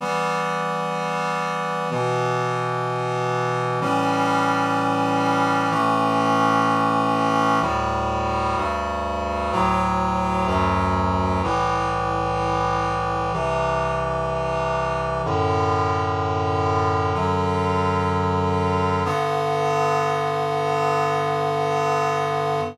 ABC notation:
X:1
M:4/4
L:1/8
Q:1/4=63
K:G
V:1 name="Clarinet"
[E,G,B,]4 [B,,E,B,]4 | [A,,E,G,^C]4 [A,,E,A,C]4 | [D,,A,,G,]2 [D,,G,,G,]2 [D,,A,,F,]2 [D,,F,,F,]2 | [C,,A,,E,]4 [C,,C,E,]4 |
[F,,A,,D,]4 [F,,D,F,]4 | [G,,D,B,]8 |]